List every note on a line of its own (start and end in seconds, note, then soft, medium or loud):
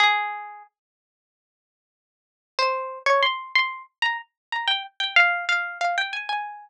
0.00 0.63 G#4 medium
2.59 2.99 C5 medium
3.06 3.22 C#5 medium
3.23 3.52 C6 medium
3.55 3.83 C6 medium
4.02 4.17 A#5 medium
4.52 4.68 A#5 medium
4.68 4.83 G5 medium
5.00 5.15 G5 medium
5.16 5.45 F5 medium
5.49 5.78 F5 medium
5.81 5.96 F5 medium
5.98 6.13 G5 medium
6.13 6.28 G#5 medium
6.29 6.69 G#5 medium